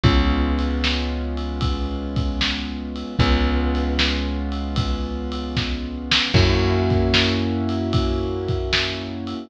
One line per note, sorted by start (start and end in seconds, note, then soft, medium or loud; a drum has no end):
0.03 3.04 C#2 loud
0.03 3.16 G#3 loud
0.03 3.16 B3 medium
0.03 3.16 C#4 medium
0.03 3.16 F4 loud
0.03 kick loud
0.03 ride loud
0.59 ride medium
0.84 snare loud
1.37 ride medium
1.61 kick medium
1.61 ride loud
2.16 kick loud
2.16 ride medium
2.41 snare loud
2.96 ride medium
3.19 6.20 C#2 loud
3.19 6.32 G#3 medium
3.19 6.32 B3 loud
3.19 6.32 C#4 medium
3.19 6.32 F4 loud
3.19 kick loud
3.19 ride loud
3.75 ride medium
3.99 snare loud
4.52 ride medium
4.76 kick loud
4.76 ride loud
5.32 ride loud
5.57 kick medium
5.57 snare medium
6.12 snare loud
6.34 9.34 F#2 loud
6.34 9.47 A#3 loud
6.34 9.47 C#4 loud
6.34 9.47 E4 loud
6.34 9.47 F#4 medium
6.34 kick loud
6.34 crash loud
6.90 kick loud
6.90 ride medium
7.14 snare loud
7.69 ride medium
7.93 kick loud
7.93 ride loud
8.48 kick medium
8.48 ride medium
8.73 snare loud
9.27 ride medium